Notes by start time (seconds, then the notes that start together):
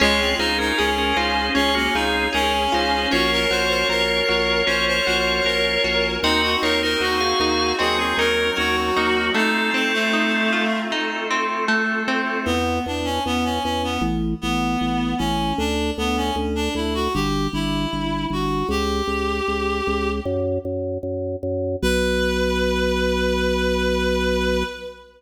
0.00 C#2 G#3 C#4 F4 G#4 C#5
0.20 C4
0.38 C#2 D#4 F4 C5
0.58 C#4 D#4 A#4
0.77 C#2 C#4 G#4
0.98 C#4 A#4
1.16 C#2 D#4 F4 C5
1.55 C#2 C#4 F4 G#4 C#5
1.75 A#3 C#4 F#4
1.94 C#2 C4 D#4 F4 G#4
2.33 C#2 C#4 G#4 A#4
2.72 C#2 D#4 F4 C5
3.11 A#1 C#4 F4 F#4 A#4 C#5
3.32 A#4
3.50 A#1 F#4 C5
3.69 C5
3.88 A#1 A#4
4.29 A#1 F#4
4.67 A#1 C#4 A#4 C5 C#5
4.88 C5
5.06 A#1 F#4 C5
5.44 A#1 A#4
5.84 A#1 F#4
6.23 D#2 C4 D#4 F#4 D#5
6.43 F#4
6.62 D#2 D#4 F4 A#4 C#5
6.82 D#4 A#4 C5
7.00 D#2 F#4
7.20 G#4 F5
7.39 D#2 D#4 G#4 F5
7.79 D#2 F#3 C4 F#4 G#4 D#5
7.98 C4 G#4
8.17 D#2 C#4 D#4 A#4
8.57 D#2 C#4 F#4 A#4
8.97 D#2 A#3 D#4 F#4
9.34 A3 C4 D#4 F4 A4
9.74 C4
9.93 A3
10.13 D#4
10.53 F4
10.90 A3 C4 D#4 F4 A4
11.31 C4
11.68 A3
12.08 C4
12.45 E2 B3
12.86 E2 D4
13.05 C#4
13.26 E2 B3
13.44 C#4
13.63 E2 C#4
13.84 B3
14.01 A1
14.41 A1 B3
14.81 A1
15.18 A1 C#4
15.58 D2 D4
15.98 D2 B3
16.17 C#4
16.36 D2
16.55 D4
16.75 D2 E4
16.94 F#4
17.14 G1 G4
17.53 G1 E4
17.93 G1
18.30 G1 F#4
18.69 C#2 G4
19.07 C#2
19.48 C#2
19.87 C#2
20.25 F#2
20.65 F#2
21.03 F#2
21.43 F#2
21.82 B1 B4